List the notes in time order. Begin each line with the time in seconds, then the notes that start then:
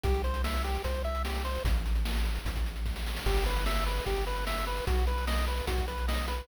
0.03 C2 G4, kick, closed hi-hat
0.14 closed hi-hat
0.24 C5, closed hi-hat
0.34 closed hi-hat
0.44 E5, snare
0.54 closed hi-hat
0.64 G4, closed hi-hat
0.75 closed hi-hat
0.84 C2 C5, kick, closed hi-hat
0.94 closed hi-hat
1.04 E5, closed hi-hat
1.15 closed hi-hat
1.25 G4, snare
1.35 closed hi-hat
1.45 C5, closed hi-hat
1.55 closed hi-hat
1.65 A1, kick, closed hi-hat
1.76 closed hi-hat
1.86 closed hi-hat
1.95 closed hi-hat
2.05 snare
2.16 closed hi-hat
2.25 closed hi-hat
2.35 closed hi-hat
2.45 A1, kick, closed hi-hat
2.55 kick, closed hi-hat
2.66 closed hi-hat
2.76 closed hi-hat
2.85 kick, snare
2.96 snare
3.06 snare
3.16 snare
3.26 G1 G4, kick, crash
3.36 closed hi-hat
3.46 B4, closed hi-hat
3.56 closed hi-hat
3.66 E5, snare
3.76 closed hi-hat
3.86 B4, closed hi-hat
3.97 closed hi-hat
4.06 G1 G4, kick, closed hi-hat
4.16 closed hi-hat
4.27 B4, closed hi-hat
4.36 closed hi-hat
4.47 E5, snare
4.57 closed hi-hat
4.67 B4, closed hi-hat
4.77 closed hi-hat
4.87 B1 F#4, kick, closed hi-hat
4.97 closed hi-hat
5.07 B4, closed hi-hat
5.18 closed hi-hat
5.27 D#5, snare
5.38 closed hi-hat
5.47 B4, closed hi-hat
5.58 closed hi-hat
5.67 B1 F#4, kick, closed hi-hat
5.78 kick, closed hi-hat
5.88 B4, closed hi-hat
5.98 closed hi-hat
6.08 D#5, snare
6.18 closed hi-hat
6.28 B4, closed hi-hat
6.38 closed hi-hat